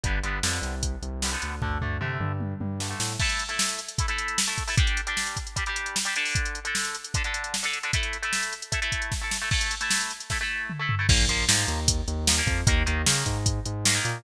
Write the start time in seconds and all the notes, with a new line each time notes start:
0.04 G1 D3 G3 B3, kick, closed hi-hat
0.24 G1 D3 G3 B3, closed hi-hat
0.43 F2 D3 G3 B3, snare
0.62 C2, closed hi-hat
0.83 kick, closed hi-hat
1.02 C2, closed hi-hat
1.22 D3 G3 B3, snare
1.32 D3 G3 B3
1.42 D2, closed hi-hat
1.62 D2 D3 A3, kick, floor tom
1.81 D2 D3 A3, floor tom
2.01 C3 D3 A3, mid tom
2.20 G2, mid tom
2.40 high tom
2.60 G2, high tom
2.80 D3 A3, snare
2.89 D3 A3
3.00 A2, snare
3.20 A3 E4 A4, kick, crash
3.29 closed hi-hat
3.39 closed hi-hat
3.49 A3 E4 A4, closed hi-hat
3.59 snare
3.69 closed hi-hat
3.79 closed hi-hat
3.89 closed hi-hat
3.98 A3 E4 A4, kick, closed hi-hat
4.08 A3 E4 A4, closed hi-hat
4.18 closed hi-hat
4.28 closed hi-hat
4.38 snare
4.48 A3 E4 A4, closed hi-hat
4.58 kick, closed hi-hat
4.68 A3 E4 A4, open hi-hat
4.77 G3 D4 G4, kick, closed hi-hat
4.87 closed hi-hat
4.97 closed hi-hat
5.07 G3 D4 G4, closed hi-hat
5.17 snare
5.27 closed hi-hat
5.37 kick, closed hi-hat
5.47 closed hi-hat
5.56 G3 D4 G4, kick, closed hi-hat
5.66 G3 D4 G4, closed hi-hat
5.76 closed hi-hat
5.86 closed hi-hat
5.96 snare
6.05 G3 D4 G4, closed hi-hat
6.16 D3 D4 A4, closed hi-hat
6.25 open hi-hat
6.35 kick, closed hi-hat
6.45 closed hi-hat
6.55 closed hi-hat
6.65 D3 D4 A4, closed hi-hat
6.75 snare
6.85 closed hi-hat
6.95 closed hi-hat
7.04 closed hi-hat
7.14 D3 D4 A4, kick, closed hi-hat
7.24 D3 D4 A4, closed hi-hat
7.34 closed hi-hat
7.44 closed hi-hat
7.54 snare
7.63 D3 D4 A4, closed hi-hat
7.73 closed hi-hat
7.83 D3 D4 A4, closed hi-hat
7.93 A3 E4 A4, kick, closed hi-hat
8.03 closed hi-hat
8.13 closed hi-hat
8.23 A3 E4 A4, closed hi-hat
8.33 snare
8.43 closed hi-hat
8.53 closed hi-hat
8.62 closed hi-hat
8.72 A3 E4 A4, kick, closed hi-hat
8.82 A3 E4 A4, closed hi-hat
8.92 kick, closed hi-hat
9.02 closed hi-hat
9.12 kick, snare
9.21 A3 E4 A4
9.31 snare
9.42 A3 E4 A4
9.51 A3 E4 A4, kick, crash
9.61 closed hi-hat
9.71 closed hi-hat
9.81 A3 E4 A4, closed hi-hat
9.91 snare
10.01 closed hi-hat
10.10 closed hi-hat
10.20 closed hi-hat
10.30 A3 E4 A4, kick, snare
10.41 A3 E4 A4
10.70 mid tom
10.80 A3 E4 A4
10.89 floor tom
10.99 A3 E4 A4
11.09 A#1 F3 A#3, kick, crash
11.29 A#1 F3 A#3, closed hi-hat
11.48 G#2 F3 A#3, snare
11.68 D#2, closed hi-hat
11.88 kick, closed hi-hat
12.08 D#2, closed hi-hat
12.27 F3 A#3, snare
12.37 F3 A#3
12.47 F2, kick, closed hi-hat
12.67 D#2 D#3 A#3, kick, closed hi-hat
12.86 D#2 D#3 A#3, closed hi-hat
13.06 C#3 D#3 A#3, snare
13.26 G#2, kick, closed hi-hat
13.46 kick, closed hi-hat
13.66 G#2, closed hi-hat
13.85 D#3 A#3, snare
13.94 D#3 A#3
14.05 A#2, closed hi-hat